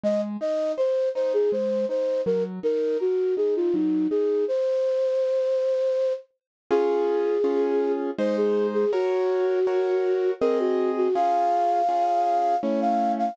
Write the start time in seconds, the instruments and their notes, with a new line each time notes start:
0.03 acoustic grand piano G#3, flute D#5
0.41 acoustic grand piano D#4, flute D#5
0.78 acoustic grand piano C5, flute C5
1.15 acoustic grand piano D#4, flute C5
1.34 flute G#4
1.52 acoustic grand piano G#3, flute C5
1.89 acoustic grand piano D#4, flute C5
2.26 acoustic grand piano F#3, flute A#4
2.63 acoustic grand piano D#4, flute A#4
3.00 flute F#4, acoustic grand piano A#4
3.37 acoustic grand piano D#4, flute G#4
3.56 flute F4
3.73 acoustic grand piano F#3, flute D#4
4.10 acoustic grand piano D#4, flute G#4
4.48 flute C5
6.71 acoustic grand piano C#4 F4 G#4, flute G#4
7.44 acoustic grand piano C#4 F4 G#4
8.18 acoustic grand piano G#3 D#4 C5, flute C5
8.37 flute G#4
8.74 flute G#4
8.92 flute F#4, acoustic grand piano F#4 A#4 C#5
9.67 acoustic grand piano F#4 A#4 C#5
10.41 acoustic grand piano C4 G#4 D#5, flute A#4
10.59 flute F#4
10.97 flute F#4
11.15 acoustic grand piano C#4 F4 G#4, flute F5
11.89 acoustic grand piano C#4 F4 G#4
12.63 acoustic grand piano A3 C#4 E4, flute C#5
12.81 flute F5
13.18 flute F5